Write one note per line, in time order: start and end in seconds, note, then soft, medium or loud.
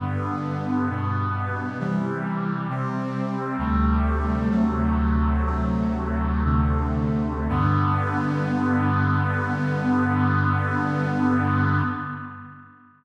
0.00 0.89 G2 medium
0.00 0.89 D3 medium
0.00 0.89 B3 medium
0.89 1.78 G2 medium
0.89 1.78 B2 medium
0.89 1.78 B3 medium
1.79 2.68 C3 medium
1.79 2.68 E3 medium
1.79 2.68 G3 medium
2.69 3.57 C3 medium
2.69 3.57 G3 medium
2.69 3.57 C4 medium
3.58 4.49 D2 medium
3.58 4.49 C3 medium
3.58 4.49 G3 medium
3.58 4.49 A3 medium
4.50 5.44 D2 medium
4.50 5.44 C3 medium
4.50 5.44 F#3 medium
4.50 5.44 A3 medium
5.45 6.44 D2 medium
5.45 6.44 C3 medium
5.45 6.44 F#3 medium
5.45 6.44 A3 medium
6.44 7.48 D2 medium
6.44 7.48 C3 medium
6.44 7.48 D3 medium
6.44 7.48 A3 medium
7.49 11.82 G2 loud
7.49 11.82 D3 medium
7.49 11.82 B3 loud